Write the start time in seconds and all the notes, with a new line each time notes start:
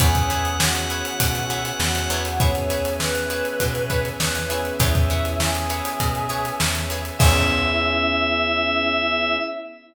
0.00 E2 B3 C#4 E4 G#4 B4 C#5 E5 F#5 G#5, kick, closed hi-hat
0.15 kick, closed hi-hat
0.30 E4 G#4 B4 C#5, closed hi-hat
0.45 closed hi-hat
0.60 F#4, snare
0.75 closed hi-hat
0.90 E4 G#4 B4 C#5, closed hi-hat
1.05 closed hi-hat
1.20 B2, kick, closed hi-hat
1.35 snare, closed hi-hat
1.50 E4 G#4 B4 C#5, snare, closed hi-hat
1.65 closed hi-hat
1.79 E2 F#4, snare
1.95 snare, closed hi-hat
2.10 E2 E4 G#4 B4 C#5, closed hi-hat
2.25 closed hi-hat
2.40 B3 C#4 E4 G#4 B4 C#5 E5 G#5, kick, closed hi-hat
2.55 closed hi-hat
2.70 E4 G#4 B4 C#5, closed hi-hat
2.85 closed hi-hat
3.00 B4, snare
3.15 closed hi-hat
3.30 E4 G#4 B4 C#5, closed hi-hat
3.45 closed hi-hat
3.60 B2, kick, closed hi-hat
3.75 closed hi-hat
3.90 E4 G#4 B4 C#5, kick, closed hi-hat
4.05 closed hi-hat
4.20 E2 B4, snare
4.35 snare, closed hi-hat
4.49 B3 C#4 E4 G#4 B4 C#5, closed hi-hat
4.65 closed hi-hat
4.79 E2 E4 G#4 B4 C#5 E5 G#5, kick, closed hi-hat
4.95 kick, closed hi-hat
5.10 E4 G#4 B4 C#5, closed hi-hat
5.25 closed hi-hat
5.40 G#4, snare
5.55 closed hi-hat
5.70 E4 G#4 B4 C#5, closed hi-hat
5.85 closed hi-hat
6.00 B2, kick, closed hi-hat
6.15 closed hi-hat
6.29 E4 G#4 B4 C#5, closed hi-hat
6.45 closed hi-hat
6.60 E2, snare
6.75 snare, closed hi-hat
6.90 E4 G#4 B4 C#5, closed hi-hat
7.05 closed hi-hat
7.19 E2 B3 C#4 E4 G#4 B4 C#5 E5, kick, crash